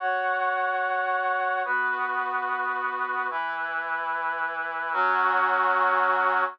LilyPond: \new Staff { \time 4/4 \key fis \mixolydian \tempo 4 = 146 <fis' cis'' fis''>1 | <b fis' b'>1 | <e e' b'>1 | <fis cis' fis'>1 | }